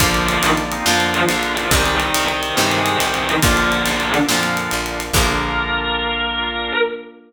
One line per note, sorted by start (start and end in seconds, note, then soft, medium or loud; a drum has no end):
0.00 0.39 A#1 loud
0.00 0.77 D3 loud
0.00 0.24 F3 loud
0.00 0.77 F3 loud
0.00 1.68 A#3 medium
0.00 0.77 A#3 loud
0.00 0.60 D4 medium
0.00 1.68 D4 medium
0.00 0.60 F4 medium
0.00 1.68 F4 medium
0.00 0.24 F4 loud
0.00 1.69 A#4 medium
0.00 1.69 D5 loud
0.00 1.69 F5 medium
0.00 kick loud
0.00 ride loud
0.14 ride medium
0.29 0.42 D#3 medium
0.29 0.42 D#4 medium
0.29 ride medium
0.43 0.82 A#1 medium
0.43 ride loud
0.57 ride medium
0.72 0.85 C4 medium
0.72 0.85 D#4 medium
0.72 ride medium
0.85 1.25 F2 medium
0.85 1.63 D3 loud
0.85 1.14 F3 medium
0.85 1.63 F3 loud
0.85 1.53 D4 medium
0.85 1.53 F4 medium
0.85 1.14 F4 medium
0.85 snare loud
0.89 1.63 A#3 loud
1.00 ride medium
1.14 ride medium
1.29 1.68 A#1 medium
1.29 1.54 D3 medium
1.29 1.54 D4 loud
1.29 ride loud
1.43 ride medium
1.57 1.70 F3 medium
1.57 1.71 D4 medium
1.57 1.71 F4 medium
1.57 1.70 F4 medium
1.57 ride medium
1.71 2.10 C2 loud
1.71 2.49 C3 loud
1.71 2.49 D#3 loud
1.71 1.94 G3 medium
1.71 2.49 G3 loud
1.71 2.00 G#3 medium
1.71 3.40 C4 medium
1.71 2.00 C4 medium
1.71 3.40 D#4 medium
1.71 1.94 G4 loud
1.71 3.40 G4 medium
1.71 3.41 C5 medium
1.71 3.41 D#5 medium
1.71 3.41 G5 medium
1.71 kick loud
1.71 ride loud
1.86 ride medium
2.00 2.24 D#3 medium
2.00 2.24 D#4 medium
2.00 ride medium
2.14 2.53 C2 medium
2.14 ride loud
2.28 2.55 D#3 medium
2.28 2.55 D#4 medium
2.28 ride medium
2.43 ride medium
2.57 2.96 G2 medium
2.57 3.34 C3 medium
2.57 3.34 D#3 loud
2.57 2.69 G3 medium
2.57 3.34 G3 loud
2.57 3.41 G#3 medium
2.57 3.41 C4 medium
2.57 2.69 G4 medium
2.57 snare loud
2.71 2.97 G#3 medium
2.71 2.97 G#4 medium
2.71 ride medium
2.86 ride medium
3.00 3.39 C2 medium
3.00 3.14 G3 medium
3.00 3.14 G4 medium
3.00 ride loud
3.14 3.27 D#3 medium
3.14 3.27 D#4 medium
3.14 ride medium
3.29 ride medium
3.42 3.82 A#1 loud
3.42 4.20 A#2 loud
3.42 4.08 D3 loud
3.42 4.20 D3 loud
3.42 4.20 F3 loud
3.42 5.11 A#3 medium
3.42 4.08 D4 loud
3.42 5.11 D4 loud
3.42 3.70 D4 medium
3.42 5.11 F4 loud
3.42 3.70 F4 medium
3.42 5.12 A#4 medium
3.42 5.12 D5 medium
3.42 5.12 F5 medium
3.42 kick loud
3.42 ride loud
3.57 ride medium
3.72 4.21 A#3 medium
3.72 4.21 D4 medium
3.72 ride medium
3.86 4.25 A#1 medium
3.86 ride medium
4.00 ride medium
4.14 ride medium
4.29 4.68 F2 medium
4.29 5.06 A#2 loud
4.29 5.06 D3 loud
4.29 5.06 F3 loud
4.29 snare loud
4.43 ride medium
4.57 ride medium
4.71 5.11 A#1 medium
4.71 ride medium
4.86 ride medium
5.00 ride medium
5.13 6.71 A#1 loud
5.13 6.72 D3 loud
5.13 6.72 F3 loud
5.13 6.72 A#3 loud
5.13 6.73 A#3 loud
5.13 6.72 D4 medium
5.13 6.73 D4 medium
5.13 6.72 F4 medium
5.13 6.73 F4 loud
5.13 6.72 A#4 loud
5.13 kick loud
5.13 crash loud
5.18 6.72 A#3 loud